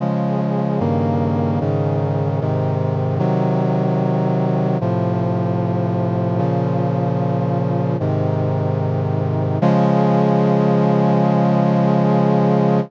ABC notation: X:1
M:4/4
L:1/8
Q:1/4=75
K:Db
V:1 name="Brass Section"
[D,F,A,]2 [=G,,D,E,B,]2 [A,,D,E,]2 [A,,C,E,]2 | [C,E,G,]4 [=A,,C,F,]4 | [B,,D,F,]4 [A,,C,E,]4 | [D,F,A,]8 |]